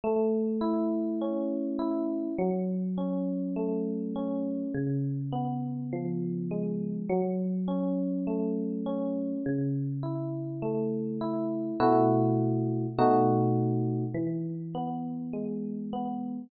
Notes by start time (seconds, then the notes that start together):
0.04 A3
0.61 E4
1.21 C#4
1.79 E4
2.38 F#3
2.98 C#4
3.56 A3
4.16 C#4
4.74 C#3
5.32 B3
5.93 F3
6.51 G#3
7.09 F#3
7.68 C#4
8.27 A3
8.86 C#4
9.46 C#3
10.03 E4
10.62 A3
11.21 E4
11.80 B2 A3 E4 F#4
12.99 B2 A3 D#4 F#4
14.14 E3
14.75 B3
15.33 G#3
15.93 B3